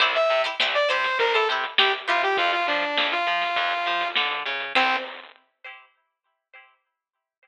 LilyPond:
<<
  \new Staff \with { instrumentName = "Lead 2 (sawtooth)" } { \time 4/4 \key c \mixolydian \tempo 4 = 101 r16 e''8 r8 d''16 c''8 bes'16 a'16 r8 g'16 r16 f'16 g'16 | f'16 f'16 d'8. f'4.~ f'16 r4 | c'4 r2. | }
  \new Staff \with { instrumentName = "Pizzicato Strings" } { \time 4/4 \key c \mixolydian <e' g' c''>8. <e' g' c''>16 <e' g' c''>8 <e' g' c''>8. <e' g' c''>16 <e' g' c''>8 <e' g' c''>8 <e' g' c''>8 | r1 | <e' g' c''>4 r2. | }
  \new Staff \with { instrumentName = "Electric Bass (finger)" } { \clef bass \time 4/4 \key c \mixolydian c,8 c8 c,8 c8 c,8 c8 c,8 c8 | f,8 f8 f,8 f8 f,8 f8 d8 des8 | c,4 r2. | }
  \new DrumStaff \with { instrumentName = "Drums" } \drummode { \time 4/4 <hh bd>16 hh16 hh16 hh16 sn16 hh16 <hh sn>16 <hh sn>16 <hh bd>16 hh16 hh16 <hh sn>16 sn16 hh16 hh16 <hh bd>16 | <hh bd>16 <hh sn>16 hh16 hh16 sn16 hh16 hh16 <hh sn>16 <hh bd>16 hh16 <hh sn>16 <hh bd>16 sn16 hh16 <hh sn>16 hh16 | <cymc bd>4 r4 r4 r4 | }
>>